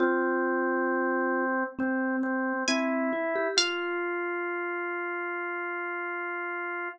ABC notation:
X:1
M:4/4
L:1/16
Q:1/4=67
K:Fm
V:1 name="Pizzicato Strings"
z12 a4 | f16 |]
V:2 name="Vibraphone"
F8 C4 C2 =E G | F16 |]
V:3 name="Drawbar Organ"
C8 C2 C2 =E4 | F16 |]